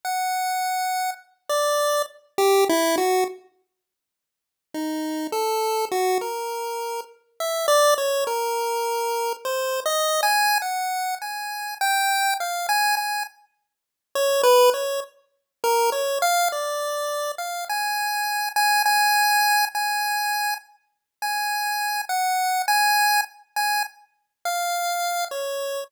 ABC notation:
X:1
M:2/4
L:1/16
Q:1/4=51
K:none
V:1 name="Lead 1 (square)"
_g4 z d2 z | G E _G z5 | _E2 A2 _G _B3 | z e d _d _B4 |
(3c2 _e2 _a2 _g2 a2 | g2 f _a a z3 | _d B d z2 _B d f | d3 f _a3 a |
_a3 a3 z2 | _a3 _g2 a2 z | _a z2 f3 _d2 |]